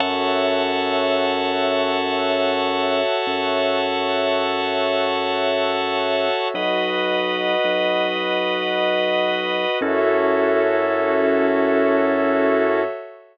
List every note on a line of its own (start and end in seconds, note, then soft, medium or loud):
0.00 3.01 F#2 loud
0.00 6.47 F#4 medium
0.00 6.47 A4 medium
0.00 6.47 C#5 medium
0.00 6.48 C#5 medium
0.00 6.47 E5 medium
0.00 6.48 E5 medium
0.00 6.48 F#5 medium
0.00 6.48 A5 loud
3.27 6.28 F#2 medium
6.54 7.55 B1 medium
6.54 9.79 F#4 medium
6.54 9.79 B4 medium
6.54 9.79 D#5 loud
6.54 9.79 D#5 medium
6.54 9.79 F#5 medium
7.64 9.65 B1 medium
9.81 12.82 F#2 loud
9.81 12.82 C#4 loud
9.81 12.82 E4 loud
9.81 12.82 F#4 medium
9.81 12.82 A4 medium
9.81 12.82 A4 loud
9.81 12.82 C#5 loud
9.81 12.82 E5 loud